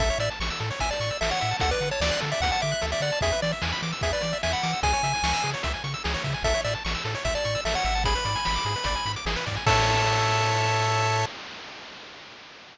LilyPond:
<<
  \new Staff \with { instrumentName = "Lead 1 (square)" } { \time 4/4 \key a \major \tempo 4 = 149 e''8 d''16 r4 r16 gis''16 d''8. e''16 fis''8. | fis''16 b'8 cis''16 d''8 r16 e''16 fis''16 fis''16 e''8. e''16 d''8 | e''8 d''16 r4 r16 e''16 d''8. e''16 fis''8. | gis''2 r2 |
e''8 d''16 r4 r16 e''16 d''8. e''16 fis''8. | b''2. r4 | a''1 | }
  \new Staff \with { instrumentName = "Lead 1 (square)" } { \time 4/4 \key a \major a'16 cis''16 e''16 a''16 cis'''16 e'''16 a'16 cis''16 e''16 a''16 cis'''16 e'''16 a'16 cis''16 e''16 a''16 | a'16 d''16 fis''16 a''16 d'''16 fis'''16 a'16 d''16 fis''16 a''16 d'''16 fis'''16 a'16 d''16 fis''16 a''16 | gis'16 b'16 d''16 e''16 gis''16 b''16 d'''16 e'''16 gis'16 b'16 d''16 e''16 gis''16 b''16 d'''16 e'''16 | gis'16 cis''16 e''16 gis''16 cis'''16 e'''16 gis'16 cis''16 e''16 gis''16 cis'''16 e'''16 gis'16 cis''16 e''16 gis''16 |
a'16 cis''16 e''16 a''16 cis'''16 e'''16 a'16 cis''16 e''16 a''16 cis'''16 e'''16 a'16 cis''16 e''16 a''16 | gis'16 b'16 d''16 gis''16 b''16 d'''16 gis'16 b'16 d''16 gis''16 b''16 d'''16 gis'16 b'16 d''16 gis''16 | <a' cis'' e''>1 | }
  \new Staff \with { instrumentName = "Synth Bass 1" } { \clef bass \time 4/4 \key a \major a,,8 a,8 a,,8 a,8 a,,8 a,8 a,,8 a,8 | d,8 d8 d,8 d8 d,8 d8 d,8 d8 | e,8 e8 e,8 e8 e,8 e8 e,8 e8 | cis,8 cis8 cis,8 cis8 cis,8 cis8 cis,8 cis8 |
a,,8 a,8 a,,8 a,8 a,,8 a,8 a,,8 gis,,8~ | gis,,8 gis,8 gis,,8 gis,8 gis,,8 gis,8 gis,,8 gis,8 | a,1 | }
  \new DrumStaff \with { instrumentName = "Drums" } \drummode { \time 4/4 <hh bd>16 hh16 hh16 hh16 sn16 hh16 hh16 hh16 <hh bd>16 hh16 hh16 hh16 sn16 hh16 hh16 hh16 | <hh bd>16 hh16 hh16 hh16 sn16 hh16 hh16 hh16 <hh bd>16 hh16 hh16 hh16 sn16 hh16 hh16 hh16 | <hh bd>16 hh16 hh16 hh16 sn16 hh16 hh16 hh16 <hh bd>16 hh16 hh16 hh16 sn16 hh16 hh16 hh16 | <hh bd>16 hh16 hh16 hh16 sn16 hh16 hh16 hh16 <hh bd>16 hh16 hh16 hh16 sn16 hh16 <hh bd>16 hh16 |
<hh bd>16 hh16 hh16 hh16 sn16 hh16 hh16 hh16 <hh bd>16 hh16 hh16 hh16 sn16 hh16 hh16 hh16 | <hh bd>16 hh16 hh16 hh16 sn16 hh16 hh16 hh16 <hh bd>16 hh16 hh16 hh16 sn16 hh16 <hh bd>16 hh16 | <cymc bd>4 r4 r4 r4 | }
>>